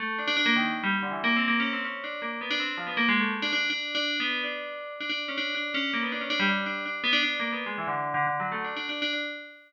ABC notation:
X:1
M:5/4
L:1/16
Q:1/4=162
K:none
V:1 name="Tubular Bells"
A,2 D D D ^A, ^D,2 z G, z =D, (3E,2 A,2 C2 (3A,2 ^C2 =C2 | ^C2 D2 ^A,2 B, D =C2 F, B, (3A,2 ^G,2 =A,2 z D D2 | (3D4 D4 B,4 D6 D D z ^C D2 | D2 ^C2 ^A, B, D C D G, D2 D2 D z B, D D2 |
(3^A,2 B,2 ^G,2 E, D,3 (3D,2 D,2 ^F,2 (3=A,2 D2 D2 (3D2 D2 D2 |]